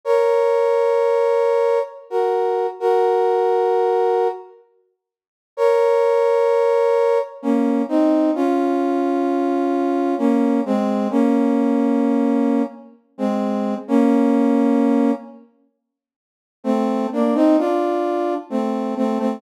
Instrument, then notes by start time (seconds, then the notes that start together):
brass section
0.05 A#4 C#5
2.10 F#4 A#4
2.80 F#4 A#4
5.57 A#4 C#5
7.42 A#3 C#4
7.88 C4 D#4
8.35 C#4 F4
10.18 A#3 C#4
10.65 G#3 C4
11.10 A#3 C#4
13.18 G#3 C4
13.88 A#3 C#4
16.64 A3 C4
17.12 A#3 D4
17.35 C4 D#4
17.58 D4 F4
18.50 A3 C4
18.96 A3 C4
19.19 A3 C4